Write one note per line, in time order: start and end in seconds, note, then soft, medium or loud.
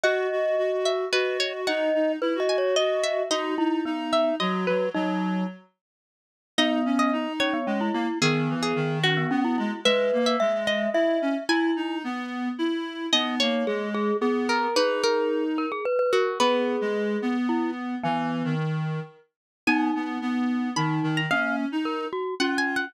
0.04 0.27 F#4 medium
0.04 0.92 D#5 medium
0.04 0.75 F#5 loud
0.31 0.56 F#4 medium
0.58 0.71 F#4 medium
0.72 1.05 F#4 medium
0.85 1.09 E5 medium
1.12 1.66 F#4 medium
1.12 1.38 B4 medium
1.12 1.61 D#5 medium
1.40 1.53 C#5 medium
1.67 1.90 D#4 medium
1.67 2.12 D#5 medium
1.67 2.39 F#5 medium
1.94 2.16 D#4 medium
2.21 2.34 E4 medium
2.21 2.39 B4 medium
2.35 2.75 F#4 medium
2.40 2.57 D#5 medium
2.49 2.76 G#5 medium
2.58 2.75 C#5 medium
2.76 3.21 F#4 medium
2.76 3.03 D#5 medium
2.76 3.23 D#5 medium
3.04 3.29 E5 loud
3.30 3.55 D#4 medium
3.30 3.55 F#4 medium
3.30 4.10 D#5 loud
3.58 3.81 D#4 medium
3.58 3.84 E4 medium
3.85 4.32 B3 medium
3.85 4.35 D#4 medium
4.13 4.35 E5 medium
4.40 4.65 F#3 medium
4.40 4.87 F#4 medium
4.40 4.64 D#5 medium
4.67 4.89 F#3 medium
4.67 4.90 B4 medium
4.94 5.44 F#3 medium
4.94 5.46 D#4 medium
4.94 5.42 D#5 loud
6.58 7.27 B3 loud
6.58 6.80 D#4 medium
6.58 6.98 D#5 loud
6.85 7.11 C#4 medium
6.99 7.33 D#5 loud
7.13 7.58 D#4 medium
7.40 7.53 C#4 medium
7.40 8.08 C#5 loud
7.54 7.66 B3 medium
7.67 7.89 G#3 medium
7.67 7.80 C#4 medium
7.81 7.94 E4 medium
7.94 8.07 A#3 medium
7.94 8.18 E4 medium
8.22 8.49 D#3 medium
8.22 8.98 B3 loud
8.22 8.56 G#4 loud
8.49 8.73 E3 medium
8.63 8.99 G#4 medium
8.76 9.24 D#3 medium
9.04 9.16 C#4 medium
9.04 9.83 F#4 loud
9.17 9.30 B3 medium
9.31 9.56 B3 medium
9.31 9.44 C#4 medium
9.44 9.57 E4 medium
9.58 9.71 G#3 medium
9.58 9.80 E4 medium
9.85 10.11 G#3 medium
9.85 10.37 B4 loud
9.85 10.19 E5 loud
10.13 10.36 A#3 medium
10.26 10.60 E5 loud
10.40 10.87 G#3 medium
10.40 10.66 E5 medium
10.67 11.43 D#5 loud
10.67 10.90 E5 medium
10.94 11.18 E4 medium
10.94 11.44 E5 medium
11.22 11.35 C#4 medium
11.49 11.71 E4 medium
11.49 11.98 E4 medium
11.49 11.96 G#5 loud
11.76 12.02 D#4 medium
12.04 12.49 B3 medium
12.59 13.06 E4 medium
13.13 13.39 B3 medium
13.13 13.66 D#4 medium
13.13 13.35 D#5 loud
13.40 13.64 A#3 medium
13.40 14.16 C#5 loud
13.67 14.11 G#3 medium
13.67 13.89 G#4 medium
13.94 14.17 G#4 loud
14.21 14.67 B3 medium
14.21 14.68 G#4 medium
14.49 14.75 A#4 loud
14.76 15.66 D#4 medium
14.76 15.44 G#4 medium
14.76 15.02 B4 loud
15.04 15.83 A#4 loud
15.58 15.71 A#4 medium
15.72 15.85 G#4 medium
15.85 15.98 B4 medium
15.99 16.12 B4 medium
16.13 16.39 F#4 loud
16.13 16.38 A#4 medium
16.40 16.76 B3 medium
16.40 17.37 G#4 medium
16.40 17.33 B4 loud
16.81 17.17 G#3 medium
17.22 17.95 B3 medium
17.49 17.71 E4 medium
18.04 18.43 E3 medium
18.04 18.55 B3 medium
18.04 18.55 G#5 loud
18.44 19.00 D#3 medium
19.67 19.90 B3 medium
19.67 20.69 D#4 loud
19.67 20.44 G#5 loud
19.95 20.18 B3 medium
20.21 20.70 B3 medium
20.76 21.00 D#3 medium
20.76 21.21 D#4 medium
20.76 21.11 B5 medium
21.03 21.26 D#3 medium
21.17 21.30 A#5 medium
21.31 21.65 A#3 medium
21.31 21.66 C#4 medium
21.31 21.56 F5 loud
21.72 22.05 D#4 medium
21.85 22.08 A#4 medium
22.13 22.35 F#4 medium
22.40 22.88 C#4 loud
22.40 22.86 F4 medium
22.40 22.57 F#5 loud
22.58 22.75 G#5 loud
22.76 22.94 F#5 loud